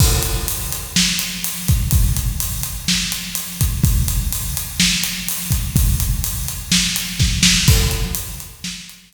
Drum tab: CC |x-------|--------|--------|--------|
HH |-xxx-xxx|xxxx-xxx|xxxx-xxx|xxxx-x--|
SD |----o---|----o---|----o---|----o-oo|
BD |o------o|o------o|o------o|o-----o-|

CC |x-------|
HH |-xxx-xx-|
SD |----o---|
BD |o-------|